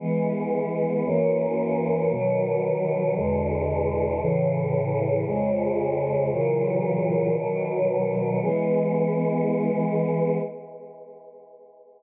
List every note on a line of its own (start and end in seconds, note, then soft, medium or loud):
0.00 1.04 E3 medium
0.00 1.04 G#3 medium
0.00 1.04 B3 medium
1.05 2.10 F#2 medium
1.05 2.10 E3 medium
1.05 2.10 A#3 medium
1.05 2.10 C#4 medium
2.11 3.15 B2 medium
2.11 3.15 D#3 medium
2.11 3.15 F#3 medium
3.16 4.20 E2 medium
3.16 4.20 B2 medium
3.16 4.20 D3 medium
3.16 4.20 G#3 medium
4.21 5.25 A2 medium
4.21 5.25 C#3 loud
4.21 5.25 E3 medium
5.26 6.30 F2 medium
5.26 6.30 C#3 medium
5.26 6.30 G#3 medium
6.31 7.35 A#2 loud
6.31 7.35 C#3 medium
6.31 7.35 E3 medium
6.31 7.35 F#3 medium
7.37 8.41 B2 medium
7.37 8.41 D#3 medium
7.37 8.41 F#3 medium
8.42 10.37 E3 medium
8.42 10.37 G#3 loud
8.42 10.37 B3 loud